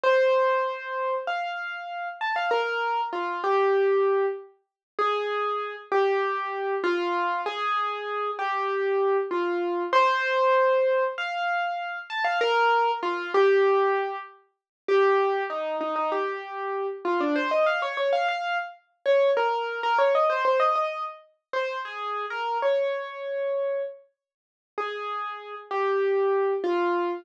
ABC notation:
X:1
M:4/4
L:1/16
Q:1/4=97
K:Ab
V:1 name="Acoustic Grand Piano"
c8 f6 =a f | B4 F2 G6 z4 | A6 G6 F4 | A6 G6 F4 |
c8 f6 =a f | B4 F2 G6 z4 | G4 E2 E E G6 F =D | c e f d d f f2 z3 d2 B3 |
B d e c c e e2 z3 c2 A3 | B2 d8 z6 | A6 G6 F4 |]